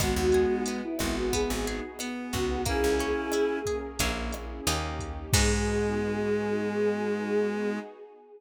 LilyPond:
<<
  \new Staff \with { instrumentName = "Choir Aahs" } { \time 4/4 \key gis \minor \tempo 4 = 90 fis'4 r16 e'8 fis'16 gis'8 r4 fis'8 | gis'2 r2 | gis'1 | }
  \new Staff \with { instrumentName = "Clarinet" } { \time 4/4 \key gis \minor <gis b>4. b4. b4 | <cis' e'>4. r8 ais8 r4. | gis1 | }
  \new Staff \with { instrumentName = "Acoustic Guitar (steel)" } { \time 4/4 \key gis \minor b8 gis'8 b8 fis'8 b8 gis'8 b8 fis'8 | ais8 cis'8 e'8 gis'8 <ais cis' e' gis'>4 <ais cis' dis' g'>4 | <b dis' fis' gis'>1 | }
  \new Staff \with { instrumentName = "Electric Bass (finger)" } { \clef bass \time 4/4 \key gis \minor gis,,16 dis,4~ dis,16 gis,,8. gis,,4~ gis,,16 cis,8~ | cis,16 cis,4.~ cis,16 ais,,4 dis,4 | gis,1 | }
  \new Staff \with { instrumentName = "Pad 2 (warm)" } { \time 4/4 \key gis \minor <b dis' fis' gis'>4 <b dis' gis' b'>4 <b dis' fis' gis'>4 <b dis' gis' b'>4 | <ais cis' e' gis'>4 <ais cis' gis' ais'>4 <ais cis' e' gis'>4 <ais cis' dis' g'>4 | <b dis' fis' gis'>1 | }
  \new DrumStaff \with { instrumentName = "Drums" } \drummode { \time 4/4 <hh bd ss>8 hh8 hh8 <hh bd ss>8 <hh bd>8 hh8 <hh ss>8 <hh bd>8 | <hh bd>8 hh8 <hh ss>8 <hh bd>8 <hh bd>8 <hh ss>8 hh8 <hh bd>8 | <cymc bd>4 r4 r4 r4 | }
>>